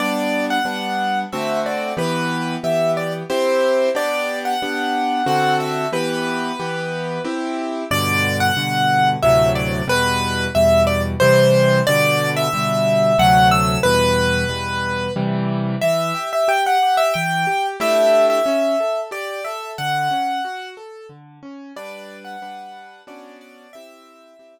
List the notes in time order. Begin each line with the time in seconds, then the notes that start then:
0.00 G3 B3 D4 D5
0.50 F#5
0.65 G3 B3 D4
1.32 D3 A3 C4 F#4 E5
1.66 D5
1.97 E3 B3 G4 B4
2.64 E3 B3 G4 E5
2.97 D5
3.30 C4 E4 G4 C5
3.95 B3 D4 G4 D5
4.45 F#5
4.62 B3 D4 G4
5.26 D3 C4 F#4 A4 F#5
5.60 E5
5.92 E3 B3 G4 B4
6.59 E3 B3 G4
7.25 C4 E4 G4
7.91 G2 B2 D3 D5
8.40 F#5
8.57 G2 B2 D3
9.23 D2 A2 C3 F#3 E5
9.55 D5
9.88 E2 B2 G3 B4
10.55 E2 B2 G3 E5
10.87 D5
11.20 C3 E3 G3 C5
11.87 B2 D3 G3 D5
12.37 E5
12.53 B2 D3 G3
13.18 D2 C3 F#3 A3 F#5
13.51 E6
13.83 E2 B2 G3 B4
14.49 E2 B2 G3
15.16 C3 E3 G3
15.81 E3 E5
16.15 G4
16.33 E5
16.48 G4 G5
16.66 F#5
16.83 G4
16.97 E5
17.14 E3 G5
17.47 G4
17.80 A3 D4 E4 G4 E5
18.30 E5
18.46 C#4
18.80 A4
19.11 G4 D5
19.45 A4 E5
19.78 D3 F#5
20.11 C#4
20.45 F#4
20.77 A4
21.09 D3
21.43 C#4
21.76 G3 D4 B4 D5
22.25 F#5
22.42 G3 D4 B4
23.07 B3 C#4 D4 F#4 D5
23.41 D5
23.73 C4 E4 G4 E5
24.39 C4 E4 G4